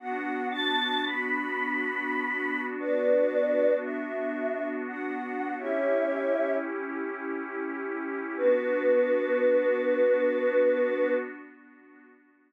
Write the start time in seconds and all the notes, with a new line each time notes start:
0.00 B3 D4 F#4 F#5
0.51 A5
1.05 B5
2.80 B4 D5
3.83 E5
4.88 F#5
5.58 C#4 E4 G4 C#5 E5
8.37 B3 D4 F#4 B4